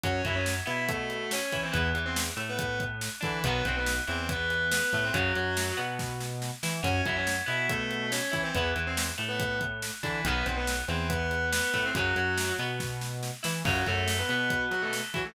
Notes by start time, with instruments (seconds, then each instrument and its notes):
0.03 synth bass 1 F#2, overdriven guitar F#3 C#4, distortion guitar C#4 C#5, kick, closed hi-hat
0.25 synth bass 1 F#2, overdriven guitar F#3, distortion guitar E4 E5, kick, closed hi-hat
0.35 distortion guitar C#4 C#5
0.46 snare
0.66 synth bass 1 B2, overdriven guitar B3, distortion guitar E4 E5, closed hi-hat
0.88 distortion guitar A3 A4, kick, closed hi-hat
1.10 closed hi-hat
1.31 distortion guitar C#4 C#5, snare
1.52 synth bass 1 E3, overdriven guitar E4, kick, closed hi-hat
1.63 distortion guitar C4 C5
1.72 synth bass 1 E2, overdriven guitar E3 B3, distortion guitar B3 B4, kick, closed hi-hat
1.95 synth bass 1 E2, overdriven guitar E3, closed hi-hat
2.06 distortion guitar C4 C5
2.16 snare
2.36 synth bass 1 A2, overdriven guitar A3, closed hi-hat
2.49 distortion guitar B3 B4
2.59 kick, closed hi-hat
2.80 kick, closed hi-hat
3.01 snare
3.21 synth bass 1 D3, distortion guitar E3 E4, overdriven guitar D4, kick, closed hi-hat
3.44 synth bass 1 B1, overdriven guitar D#3 F#3 B3, distortion guitar B3 B4, kick, closed hi-hat
3.65 synth bass 1 B1, overdriven guitar B2, distortion guitar C4 C5, kick, closed hi-hat
3.77 distortion guitar B3 B4
3.86 snare
4.07 synth bass 1 E2, overdriven guitar E3, distortion guitar C4 C5, closed hi-hat
4.29 distortion guitar B3 B4, kick, closed hi-hat
4.50 closed hi-hat
4.71 distortion guitar B3 B4, snare
4.93 synth bass 1 A2, overdriven guitar A3, kick, closed hi-hat
5.04 distortion guitar C4 C5
5.13 synth bass 1 F#2, overdriven guitar C#3 F#3, distortion guitar F#3 F#4, kick, closed hi-hat
5.35 synth bass 1 F#2, overdriven guitar F#3, closed hi-hat
5.57 snare
5.77 synth bass 1 B2, overdriven guitar B3, closed hi-hat
5.99 kick, snare
6.20 snare
6.42 snare
6.63 synth bass 1 E3, overdriven guitar E4, snare
6.83 synth bass 1 F#2, overdriven guitar F#3 C#4, distortion guitar C#4 C#5, kick, closed hi-hat
7.05 synth bass 1 F#2, overdriven guitar F#3, distortion guitar E4 E5, kick, closed hi-hat
7.16 distortion guitar C#4 C#5
7.27 snare
7.46 synth bass 1 B2, overdriven guitar B3, distortion guitar E4 E5, closed hi-hat
7.69 distortion guitar A3 A4, kick, closed hi-hat
7.91 closed hi-hat
8.12 distortion guitar C#4 C#5, snare
8.31 synth bass 1 E3, overdriven guitar E4, kick, closed hi-hat
8.43 distortion guitar C4 C5
8.55 synth bass 1 E2, overdriven guitar E3 B3, distortion guitar B3 B4, kick, closed hi-hat
8.75 synth bass 1 E2, overdriven guitar E3, closed hi-hat
8.87 distortion guitar C4 C5
8.97 snare
9.18 synth bass 1 A2, overdriven guitar A3, closed hi-hat
9.29 distortion guitar B3 B4
9.40 kick, closed hi-hat
9.61 kick, closed hi-hat
9.82 snare
10.03 synth bass 1 D3, distortion guitar E3 E4, overdriven guitar D4, kick, closed hi-hat
10.25 synth bass 1 B1, overdriven guitar D#3 F#3 B3, distortion guitar B3 B4, kick, closed hi-hat
10.46 synth bass 1 B1, overdriven guitar B2, distortion guitar C4 C5, kick, closed hi-hat
10.57 distortion guitar B3 B4
10.67 snare
10.88 synth bass 1 E2, overdriven guitar E3, distortion guitar C4 C5, closed hi-hat
11.09 distortion guitar B3 B4, kick, closed hi-hat
11.31 closed hi-hat
11.52 distortion guitar B3 B4, snare
11.74 synth bass 1 A2, overdriven guitar A3, kick, closed hi-hat
11.85 distortion guitar C4 C5
11.95 synth bass 1 F#2, overdriven guitar C#3 F#3, distortion guitar F#3 F#4, kick, closed hi-hat
12.16 synth bass 1 F#2, overdriven guitar F#3, closed hi-hat
12.38 snare
12.59 synth bass 1 B2, overdriven guitar B3, closed hi-hat
12.80 kick, snare
13.01 snare
13.23 snare
13.43 synth bass 1 E3, overdriven guitar E4, snare
13.65 synth bass 1 F#2, overdriven guitar C#3 F#3, distortion guitar F#3 F#4, kick, crash
13.86 synth bass 1 F#2, overdriven guitar F#3, distortion guitar A3 A4, kick, closed hi-hat
14.08 snare
14.19 distortion guitar B3 B4
14.29 synth bass 1 B2, overdriven guitar B3, closed hi-hat
14.50 kick, closed hi-hat
14.71 distortion guitar F#3 F#4, closed hi-hat
14.82 distortion guitar A3 A4
14.93 snare
15.14 synth bass 1 E3, distortion guitar F#3 F#4, overdriven guitar E4, kick, closed hi-hat
15.24 distortion guitar A3 A4